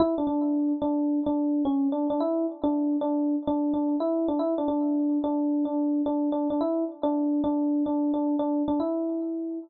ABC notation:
X:1
M:4/4
L:1/16
Q:"Swing 16ths" 1/4=109
K:Edor
V:1 name="Electric Piano 1"
E D D4 D3 D3 C2 D D | E2 z D3 D3 D2 D2 E2 D | E D D4 D3 D3 D2 D D | E2 z D3 D3 D2 D2 D2 D |
E6 z10 |]